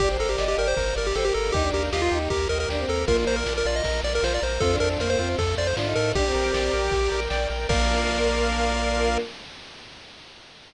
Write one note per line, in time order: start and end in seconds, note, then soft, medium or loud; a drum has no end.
0.00 0.17 G1 loud
0.00 0.77 A#3 medium
0.00 0.77 D4 medium
0.00 0.09 G4 loud
0.00 0.17 G4 loud
0.00 0.77 G4 medium
0.00 0.10 D5 medium
0.00 kick medium
0.00 crash medium
0.10 0.33 C5 medium
0.19 0.36 G1 medium
0.19 0.29 A4 medium
0.19 0.37 A#4 medium
0.19 ride medium
0.29 0.45 G4 medium
0.38 0.55 G1 medium
0.38 0.56 D5 medium
0.38 0.47 D#5 medium
0.38 snare medium
0.48 0.57 G4 medium
0.48 0.57 D#5 medium
0.57 0.74 G1 medium
0.57 0.75 G4 medium
0.57 0.68 A#4 medium
0.57 0.73 D5 medium
0.57 ride medium
0.68 0.95 C5 medium
0.77 0.94 G1 loud
0.77 1.55 G3 medium
0.77 1.54 A#3 medium
0.77 1.54 G4 medium
0.77 0.94 A#4 medium
0.77 kick medium
0.77 ride medium
0.96 1.13 G1 loud
0.96 1.07 A#4 medium
0.96 1.13 D5 medium
0.96 ride medium
1.07 1.16 G4 medium
1.15 1.32 G1 medium
1.15 1.33 G4 medium
1.15 1.25 A4 medium
1.15 1.25 C5 medium
1.15 snare medium
1.25 1.34 G4 medium
1.25 1.52 A#4 medium
1.34 1.51 G1 medium
1.34 1.53 A4 medium
1.34 1.52 A#4 medium
1.34 ride medium
1.52 1.71 D#2 loud
1.52 2.30 A#3 medium
1.52 1.63 D#4 medium
1.52 2.30 D#4 medium
1.52 1.70 G4 loud
1.52 1.71 G4 loud
1.52 2.30 G4 medium
1.52 kick medium
1.52 ride medium
1.63 1.88 D4 medium
1.72 1.90 D#2 medium
1.72 1.83 G4 medium
1.72 1.90 A#4 medium
1.72 ride medium
1.92 2.09 D#2 medium
1.92 2.01 F4 medium
1.92 2.02 G4 medium
1.92 2.10 D#5 medium
1.92 snare loud
2.02 2.19 F4 medium
2.02 2.11 F4 medium
2.11 2.28 D#2 loud
2.11 2.29 D#4 medium
2.11 2.29 G4 medium
2.11 ride medium
2.30 2.47 D#2 medium
2.30 3.05 A#3 medium
2.30 2.48 G4 medium
2.30 3.06 G4 medium
2.30 3.06 A#4 medium
2.30 2.48 A#4 medium
2.30 kick medium
2.30 ride medium
2.49 2.66 D#2 loud
2.49 2.58 A#4 medium
2.49 2.67 D#5 medium
2.49 ride medium
2.60 2.69 A#4 medium
2.69 2.85 D#2 medium
2.69 2.79 D4 medium
2.69 2.87 G4 medium
2.69 snare medium
2.79 3.02 C4 medium
2.88 3.05 D#2 medium
2.88 3.05 A4 medium
2.88 3.06 A#4 medium
2.88 ride medium
3.06 3.24 A#1 loud
3.06 3.82 A#3 medium
3.06 3.39 A#3 loud
3.06 3.82 D4 medium
3.06 3.82 F4 medium
3.06 3.25 F4 loud
3.06 3.17 A#4 medium
3.06 kick medium
3.06 ride medium
3.27 3.43 A#1 medium
3.27 3.44 A#4 medium
3.27 3.36 C5 medium
3.27 ride medium
3.36 3.54 A#4 medium
3.46 3.63 A#1 loud
3.46 3.63 D5 medium
3.46 snare medium
3.58 3.67 A#4 medium
3.65 3.82 A#1 loud
3.65 3.83 F4 medium
3.65 3.76 D5 medium
3.65 ride medium
3.76 4.01 D#5 medium
3.84 4.01 A#1 medium
3.84 4.61 A#3 medium
3.84 4.61 F4 medium
3.84 4.02 A#4 medium
3.84 4.61 A#4 medium
3.84 kick medium
3.84 ride medium
4.03 4.20 A#1 loud
4.03 4.21 D5 medium
4.03 4.13 D5 medium
4.03 ride medium
4.15 4.24 A#4 medium
4.23 4.39 A#1 medium
4.23 4.40 F4 medium
4.23 4.33 C5 medium
4.23 snare loud
4.34 4.43 D5 medium
4.42 4.59 A#1 loud
4.42 4.60 A#4 medium
4.42 4.61 C5 medium
4.42 ride medium
4.60 4.78 F2 loud
4.60 5.38 A3 medium
4.60 4.71 C4 medium
4.60 5.39 C4 medium
4.60 4.79 F4 medium
4.60 5.38 F4 medium
4.60 4.76 A4 loud
4.60 kick medium
4.60 ride medium
4.72 5.00 D4 medium
4.80 4.97 F2 loud
4.80 4.98 A4 medium
4.80 4.89 A#4 loud
4.80 ride medium
4.99 5.16 F2 medium
4.99 5.09 A#3 medium
4.99 5.10 A#4 medium
4.99 5.17 C5 medium
4.99 snare medium
5.09 5.19 A#3 medium
5.09 5.29 C5 medium
5.19 5.35 F2 loud
5.19 5.37 C4 medium
5.19 5.37 F4 medium
5.19 ride medium
5.38 5.55 F2 loud
5.38 6.14 F3 medium
5.38 6.14 A3 medium
5.38 6.14 F4 medium
5.38 5.56 A4 medium
5.38 5.55 A4 medium
5.38 kick medium
5.38 ride medium
5.57 5.74 F2 loud
5.57 5.75 C5 medium
5.57 5.67 D5 medium
5.57 ride medium
5.67 5.76 C5 medium
5.77 5.94 G#2 medium
5.77 5.86 D4 medium
5.77 5.94 F4 medium
5.77 snare loud
5.86 6.10 D#4 medium
5.95 6.13 A2 loud
5.95 6.13 A4 medium
5.95 6.12 A#4 medium
5.95 ride medium
6.14 6.31 A#1 loud
6.14 6.25 D4 medium
6.14 6.33 G4 loud
6.14 7.20 G4 loud
6.14 7.66 A#4 medium
6.14 7.66 D5 medium
6.14 7.66 G5 medium
6.14 kick medium
6.14 ride medium
6.26 6.73 C4 medium
6.34 6.51 A#1 loud
6.34 6.52 A#4 medium
6.34 ride medium
6.53 6.70 A#1 medium
6.53 6.71 D5 medium
6.53 snare loud
6.53 ride soft
6.73 6.90 A#1 loud
6.73 6.90 A#4 medium
6.73 ride medium
6.91 7.09 A#1 medium
6.91 7.10 G4 medium
6.91 kick medium
6.91 ride medium
7.12 7.28 A#1 medium
7.12 7.29 A#4 medium
7.12 ride medium
7.30 7.47 A#1 loud
7.30 7.48 D5 medium
7.30 snare loud
7.50 7.66 A#1 loud
7.50 7.67 A#4 medium
7.50 ride medium
7.69 9.18 A#1 loud
7.69 9.18 A#3 loud
7.69 9.19 A#3 loud
7.69 9.18 D4 loud
7.69 9.18 F4 loud
7.69 9.18 A#4 loud
7.69 9.18 A#4 medium
7.69 9.18 D5 loud
7.69 9.18 F5 loud
7.69 kick loud
7.69 crash loud